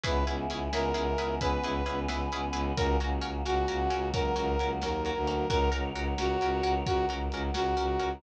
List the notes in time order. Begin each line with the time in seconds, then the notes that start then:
0.04 C#2 B3 C#4 E4 G#4 B4, kick, closed hi-hat
0.26 C#2 C#4 E4 G#4 B4, closed hi-hat
0.49 C#2 C#4 E4 G#4 B4, closed hi-hat
0.72 C#2 C#4 E4 G#4 A#4 B4, snare
0.94 C#2 C#4 E4 G#4 B4, closed hi-hat
1.18 C#2 C#4 E4 G#4 B4, closed hi-hat
1.40 C#2 B3 C#4 E4 G#4 B4, kick, closed hi-hat
1.62 C#2 C#4 E4 G#4 B4, closed hi-hat
1.86 C#2 C#4 E4 G#4 B4, closed hi-hat
2.08 C#2 C#4 E4 G#4 B4, snare
2.31 C#2 C#4 E4 G#4 B4, closed hi-hat
2.53 C#2 C#4 E4 G#4 B4, closed hi-hat
2.76 C#2 A#3 C#4 F#4 A#4, kick, closed hi-hat
3.00 C#2 C#4 F#4 A#4, closed hi-hat
3.21 C#2 C#4 F#4 A#4, closed hi-hat
3.45 C#2 C#4 F#4 A#4, snare
3.68 C#2 C#4 F#4 A#4, closed hi-hat
3.90 C#2 C#4 F#4 A#4, closed hi-hat
4.13 C#2 F#3 A#3 C#4 F#4 A#4, kick, closed hi-hat
4.36 C#2 C#4 F#4 A#4, closed hi-hat
4.59 C#2 C#4 F#4 A#4, closed hi-hat
4.82 D#2 C#4 F#4 A#4, snare
5.03 C#4 F#4 A#4, closed hi-hat
5.15 D2
5.27 C#4 F#4 A#4, closed hi-hat
5.50 C#2 C#4 F#4 A#4 C#5 F#5, kick, closed hi-hat
5.72 C#2 C#4 F#4 A#4, closed hi-hat
5.95 C#2 C#4 F#4 A#4, closed hi-hat
6.17 C#2 C#4 F#4 A#4, snare
6.41 C#2 C#4 F#4 A#4, closed hi-hat
6.63 C#2 C#4 F#4 A#4, closed hi-hat
6.86 C#2 C#4 F#4 A#4 F#5, kick, closed hi-hat
7.09 C#2 C#4 F#4 A#4, closed hi-hat
7.31 C#2 C#4 F#4 A#4, closed hi-hat
7.54 C#2 C#4 F#4 A#4, snare
7.77 C#2 C#4 F#4 A#4, closed hi-hat
7.99 C#2 C#4 F#4 A#4, closed hi-hat